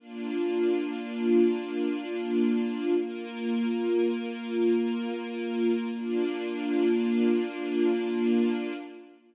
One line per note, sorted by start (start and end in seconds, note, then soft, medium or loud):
0.00 2.93 A#3 medium
0.00 2.93 D4 medium
0.00 2.93 F4 medium
2.96 5.90 A#3 medium
2.96 5.90 F4 medium
2.96 5.90 A#4 medium
5.93 8.73 A#3 loud
5.93 8.73 D4 loud
5.93 8.73 F4 medium